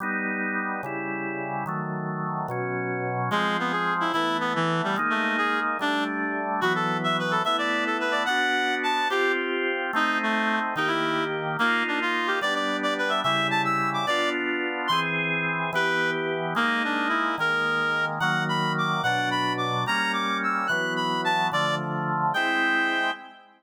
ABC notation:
X:1
M:6/8
L:1/8
Q:3/8=145
K:G
V:1 name="Clarinet"
z6 | z6 | z6 | z6 |
_A,2 B, _A2 E | E2 B, E,2 G, | z A,2 _A2 z | D2 z4 |
F A2 e B A | e d2 A B d | f4 a2 | G2 z4 |
_E2 A,3 z | _E =E3 z2 | _B,2 D =F2 G | d d2 d B e |
e2 a e'2 d' | d2 z4 | ^b z5 | B3 z3 |
_B,2 D2 E2 | _B5 z | _g2 b2 d'2 | f2 b2 d'2 |
_b2 d'2 e'2 | f'2 b2 a2 | d2 z4 | g6 |]
V:2 name="Drawbar Organ"
[G,B,^D]6 | [^C,G,E]6 | [_E,_G,A,]6 | [B,,F,^C]6 |
[=F,_A,C]6 | [E,A,B,]6 | [_A,_B,_E]6 | [G,A,D]6 |
[E,F,B,]6 | [A,B,E]6 | [B,DF]6 | [C=FG]6 |
[A,C_E]6 | [_E,_B,G]6 | [_B,_E=F]6 | [G,B,D]6 |
[^C,G,E]6 | [B,D=F]6 | [E,^B,^G]6 | [E,B,G]6 |
[_A,_B,_E]6 | [_E,_A,_B,]6 | [_E,_G,_B,]6 | [B,,F,D]6 |
[G,_B,_D]6 | [E,F,B,]6 | [D,=F,A,]6 | [_A,CE]6 |]